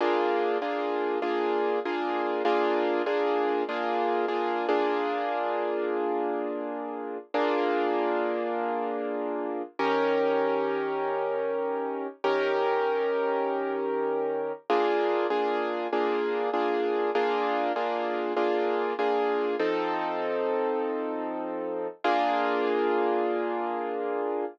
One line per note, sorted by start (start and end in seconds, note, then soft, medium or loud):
0.01 0.58 A#3 loud
0.01 0.58 D4 medium
0.01 0.58 F4 medium
0.01 0.58 G#4 medium
0.62 1.19 A#3 medium
0.62 1.19 D4 medium
0.62 1.19 F4 medium
0.62 1.19 G#4 medium
1.22 1.79 A#3 medium
1.22 1.79 D4 medium
1.22 1.79 F4 medium
1.22 1.79 G#4 medium
1.85 2.42 A#3 medium
1.85 2.42 D4 medium
1.85 2.42 F4 medium
1.85 2.42 G#4 medium
2.45 3.02 A#3 loud
2.45 3.02 D4 medium
2.45 3.02 F4 loud
2.45 3.02 G#4 medium
3.06 3.63 A#3 medium
3.06 3.63 D4 medium
3.06 3.63 F4 medium
3.06 3.63 G#4 medium
3.69 4.26 A#3 medium
3.69 4.26 D4 medium
3.69 4.26 F4 medium
3.69 4.26 G#4 medium
4.28 4.67 A#3 medium
4.28 4.67 D4 medium
4.28 4.67 F4 medium
4.28 4.67 G#4 medium
4.69 7.18 A#3 medium
4.69 7.18 D4 medium
4.69 7.18 F4 medium
4.69 7.18 G#4 medium
7.34 9.62 A#3 loud
7.34 9.62 D4 loud
7.34 9.62 F4 medium
7.34 9.62 G#4 medium
9.79 12.07 D#3 medium
9.79 12.07 C#4 loud
9.79 12.07 G4 medium
9.79 12.07 A#4 medium
12.24 14.52 D#3 medium
12.24 14.52 C#4 medium
12.24 14.52 G4 medium
12.24 14.52 A#4 medium
14.70 15.27 A#3 loud
14.70 15.27 D4 medium
14.70 15.27 F4 medium
14.70 15.27 G#4 medium
15.30 15.87 A#3 medium
15.30 15.87 D4 medium
15.30 15.87 F4 medium
15.30 15.87 G#4 medium
15.93 16.50 A#3 medium
15.93 16.50 D4 medium
15.93 16.50 F4 medium
15.93 16.50 G#4 medium
16.54 17.11 A#3 medium
16.54 17.11 D4 medium
16.54 17.11 F4 medium
16.54 17.11 G#4 medium
17.15 17.72 A#3 medium
17.15 17.72 D4 medium
17.15 17.72 F4 medium
17.15 17.72 G#4 medium
17.76 18.33 A#3 medium
17.76 18.33 D4 medium
17.76 18.33 F4 medium
17.76 18.33 G#4 medium
18.36 18.93 A#3 medium
18.36 18.93 D4 medium
18.36 18.93 F4 medium
18.36 18.93 G#4 medium
18.99 19.56 A#3 medium
18.99 19.56 D4 medium
18.99 19.56 F4 medium
18.99 19.56 G#4 medium
19.59 21.88 F3 medium
19.59 21.88 C4 medium
19.59 21.88 D#4 medium
19.59 21.88 A4 medium
22.04 24.45 A#3 loud
22.04 24.45 D4 medium
22.04 24.45 F4 loud
22.04 24.45 G#4 loud